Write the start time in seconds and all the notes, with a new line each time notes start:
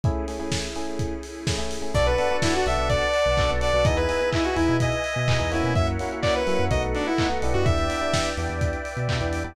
0.03 A3 C#4 E4 G#4, kick, closed hi-hat
0.28 A3 C#4 E4 G#4, open hi-hat
0.39 A3 C#4 E4 G#4
0.52 kick, snare
0.75 A3 C#4 E4 G#4, open hi-hat
0.99 kick, closed hi-hat
1.23 open hi-hat
1.47 A3 C#4 E4 G#4, kick, snare
1.58 A3 C#4 E4 G#4
1.71 open hi-hat
1.82 A3 C#4 E4 G#4
1.94 B1 B3 D4 F#4 A4 B4 D5 F#5 A5, kick, crash
2.06 B4, closed hi-hat
2.18 B3 D4 F#4 A4, open hi-hat
2.30 B3 D4 F#4 A4, closed hi-hat
2.42 E4, kick, snare
2.54 F#4, closed hi-hat
2.66 B1 B3 D4 F#4 A4 E5, open hi-hat
2.78 B1, closed hi-hat
2.89 D5, kick, closed hi-hat
3.02 closed hi-hat
3.14 open hi-hat
3.25 B1, closed hi-hat
3.37 B3 D4 F#4 A4, kick, clap
3.49 B1 B3 D4 F#4 A4, closed hi-hat
3.61 D5, open hi-hat
3.73 B1 B3 D4 F#4 A4, closed hi-hat
3.85 E2 B3 D#4 E4 G#4 B4 D#5 E5 G#5, kick, closed hi-hat
3.97 B4, closed hi-hat
4.09 B3 D#4 E4 G#4, open hi-hat
4.21 B3 D#4 E4 G#4, closed hi-hat
4.33 E4, kick, clap
4.44 F#4, closed hi-hat
4.56 E2 B3 D#4 E4 G#4, open hi-hat
4.68 B2, closed hi-hat
4.80 D#5, kick, closed hi-hat
4.92 closed hi-hat
5.04 open hi-hat
5.16 B2, closed hi-hat
5.28 B3 D#4 E4 G#4, kick, clap
5.39 E2 B3 D#4 E4 G#4, closed hi-hat
5.52 A#3 C#4 E4 F#4, open hi-hat
5.63 B2, closed hi-hat
5.75 F#2 A#4 C#5 E5 F#5, kick, closed hi-hat
5.87 closed hi-hat
5.99 A#3 C#4 E4 F#4, open hi-hat
6.11 A#3 C#4 E4 F#4, closed hi-hat
6.22 D5, kick, clap
6.35 B4, closed hi-hat
6.47 F#3 A#3 C#4 E4 F#4, open hi-hat
6.59 F#2, closed hi-hat
6.71 B1 A3 B3 D#4 F#4 A4 B4 D#5 F#5, kick, closed hi-hat
6.83 closed hi-hat
6.95 D4, open hi-hat
7.06 E4, closed hi-hat
7.18 A3 B3 D#4 F#4, kick, clap
7.30 A3 B3 D#4 F#4, closed hi-hat
7.42 B1 B3 D4 E4 G4, open hi-hat
7.54 F#2 F#4, closed hi-hat
7.65 E2 B4 D5 E5 G5, kick, closed hi-hat
7.78 closed hi-hat
7.90 B3 D4 E4 G4, open hi-hat
8.01 B3 D4 E4 G4, closed hi-hat
8.14 kick, snare
8.25 closed hi-hat
8.37 E2 B3 D4 E4 G4, open hi-hat
8.49 E2, closed hi-hat
8.61 kick, closed hi-hat
8.73 closed hi-hat
8.85 open hi-hat
8.97 B2, closed hi-hat
9.09 B3 D4 E4 G4, kick, clap
9.21 E2 B3 D4 E4 G4, closed hi-hat
9.33 open hi-hat
9.44 E2 B3 D4 E4 G4, closed hi-hat